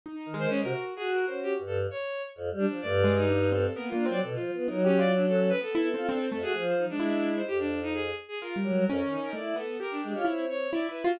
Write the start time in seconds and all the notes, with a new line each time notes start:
0.06 D#4
0.16 D#4
0.26 D#3
0.34 G#3
0.39 C5
0.49 C#4
0.61 C3 A#4
0.66 F#4
0.96 F#4 G#4
1.13 A#4
1.26 C#4 C5
1.43 G4
1.59 G2
1.67 A4
1.91 C#5
2.36 F2
2.51 G3
2.59 D4
2.68 F3
2.81 G2 A3 D5
3.04 G#3
3.18 D#4
3.29 D4
3.52 C4 A4
3.75 A#3 B3 A#4
3.89 A#3 D4 F4
4.06 F#3 C4
4.11 D5
4.22 B2 A4
4.35 F3 F4
4.53 B3 F4
4.68 F#3 D#4 A#4
4.85 C#4 G4
4.98 F4 D5
5.16 C#4 D4
5.28 A4
5.49 B4
5.61 B3 A4
5.73 B3 E4
5.94 C4 F4
6.08 C4 D4
6.31 F2 A3 A4
6.42 F#4 G#4
6.54 F3
6.67 C5
6.78 D#4
6.89 G#3 D4
7.00 E4
7.36 C5
7.47 F2 G4
7.59 D4
7.83 D#4
7.94 G#4
8.28 G#4
8.41 F4 A#4
8.56 G3
8.64 F#3
8.72 G3
8.86 F2 C#4
9.02 D#3
9.10 D#4
9.19 D#4
9.23 A#4
9.33 A3 E4 D5
9.56 B3 A4
9.80 G4 A#4
9.91 D4
10.03 G#3 D4
10.15 F4 C#5
10.25 C4 E4
10.50 C#5
10.73 E4 D5
10.89 E4 B4
11.04 F4 F#4